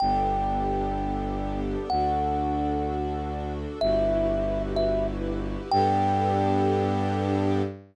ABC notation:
X:1
M:6/8
L:1/8
Q:3/8=63
K:G
V:1 name="Kalimba"
g6 | f6 | e3 e z2 | g6 |]
V:2 name="String Ensemble 1"
[B,DGA]6 | [DFA]6 | [EFGB]6 | [B,DGA]6 |]
V:3 name="Violin" clef=bass
G,,,6 | D,,6 | G,,,6 | G,,6 |]